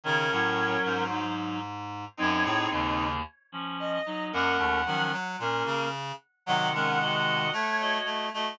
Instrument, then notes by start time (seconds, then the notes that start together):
clarinet
0.04 C#3 D#3 C#4 A#4 C#5
0.32 A2 F#3
0.85 G#2 C5
1.10 F#3 D#4
2.17 F#2 F#3 C4 D#4 C#5
2.44 A2 C4 G#4
2.71 D#2 C#3 A#3
3.52 F3 C#4
3.79 D#5
4.06 F#3 D#4
4.32 F#2 A#3 C#4 A#4 F#5
4.58 D#2 A3
4.86 D#3 F3 F#3 C#4
5.12 F#3
5.39 A#2 A#3 C#4 A#4
5.66 C#3
6.46 C3 D#3 F#3 F#4 D#5 F#5
6.74 G#3 C#4 A#4
7.01 F#4 D#5
7.53 A3 C#5
7.80 F#4 D#5
8.05 A3
8.34 A3 F#4 D#5